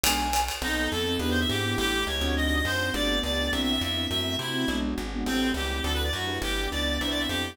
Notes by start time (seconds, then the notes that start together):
0.04 B1 G#3 B3 D4 F#4 G#5, ride
0.33 hi-hat pedal, ride
0.48 ride
0.62 B1 B3 C4 D#4 A4
0.92 F2 A4
1.07 B3 C4 D#4 A4
1.19 E2 B3 D4 E4 G4 B4
1.30 C5
1.40 E5
1.49 G#2 G4
1.65 B3 D4 E4 G4
1.77 A1 A3 C#4 E4 G4
2.07 C#2 C#5
2.21 D2 C4 D4 D#4 F#4
2.36 C4 D4 D#4 F#4 D#5
2.46 D#5
2.56 D#5
2.65 F#2 C5
2.80 C4 D4 D#4 F#4
2.94 G1 A3 B3 D4 G4 D5
3.23 C#2 D5
3.39 A3 B3 D4 G4
3.52 C2 B3 C4 D4 E4 E5
3.62 E5
3.72 E5
3.81 F2 E5
3.97 B3 C4 D4 E4
4.10 F#2 A3 C4 E4 F#4 E5
4.39 C3 E4
4.54 A3 C4 E4 F#4
4.68 B1 G#3 B3 D4 F#4
4.98 G#1
5.14 G#3 B3 D4 F#4
5.26 A1 G3 A3 C4 E4 G4 A4
5.54 C#2 G4
5.84 D2 F#3 A3 D4 E4 F#4 A4
5.94 B4
6.04 D5
6.13 F#2 F#4
6.28 D4 E4 G4 B4
6.42 G1 G3 B3 D4 E4 G4
6.72 C#2 D5
7.00 C2 B3 C4 D4 E4 B4 C5 E5
7.10 D5
7.20 E5
7.29 F2 G4